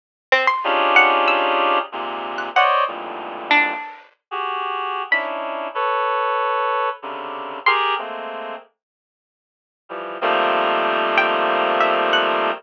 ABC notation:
X:1
M:4/4
L:1/16
Q:1/4=94
K:none
V:1 name="Clarinet"
z4 [_D=D_EFG_A]8 [_A,,_B,,C,]4 | [c_d=d_e]2 [F,,G,,_A,,=A,,_B,,]6 z3 [_G=G_A]5 | [_D=D_E=E]4 [AB_d]8 [C,_D,=D,]4 | [G_A_B]2 [_A,=A,_B,C]4 z8 [E,F,G,]2 |
[_E,F,G,A,_B,C]16 |]
V:2 name="Harpsichord"
z2 C c'2 z _g z e'6 z _g' | _g6 D8 z2 | b z15 | c'12 z4 |
z6 g z3 e z _g3 z |]